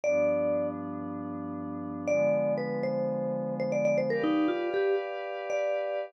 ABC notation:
X:1
M:4/4
L:1/16
Q:1/4=118
K:Cm
V:1 name="Vibraphone"
d6 z10 | d4 _c2 =c6 c d d c | B E2 F2 G2 z4 d5 |]
V:2 name="Pad 5 (bowed)"
[G,,F,=B,D]16 | [D,F,A,_C]16 | [G=Bdf]16 |]